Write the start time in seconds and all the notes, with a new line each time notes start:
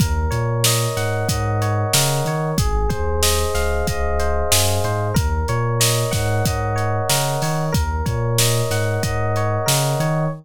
0.00 D#2 A#4, kick, closed hi-hat
0.31 A#2 C#5, closed hi-hat
0.64 D#5, snare
0.97 G#2 F#5, snare, closed hi-hat
1.29 G#2 D#5, kick, closed hi-hat
1.62 C#5, closed hi-hat
1.93 C#3 A#4, snare
2.25 D#3 C#5, closed hi-hat
2.58 G#1 G#4, kick, closed hi-hat
2.89 D#2 C5, kick, closed hi-hat
3.23 D#5, snare
3.55 C#2 F5, snare, closed hi-hat
3.87 C#2 D#5, kick, closed hi-hat
4.19 C5, closed hi-hat
4.51 F#2 G#4, snare
4.84 G#2 C5, closed hi-hat
5.14 D#2 A#4, kick, closed hi-hat
5.48 A#2 C#5, closed hi-hat
5.80 D#5, snare
6.11 G#2 F#5, kick, snare, closed hi-hat
6.45 G#2 D#5, kick, closed hi-hat
6.76 C#5, closed hi-hat
7.09 C#3 A#4, snare
7.42 D#3 C#5, open hi-hat
7.72 D#2 A#4, kick, closed hi-hat
8.06 A#2 C#5, kick, closed hi-hat
8.38 D#5, snare
8.70 G#2 F#5, snare, closed hi-hat
9.03 G#2 D#5, kick, closed hi-hat
9.36 C#5, closed hi-hat
9.66 C#3 A#4, snare
10.00 D#3 C#5, closed hi-hat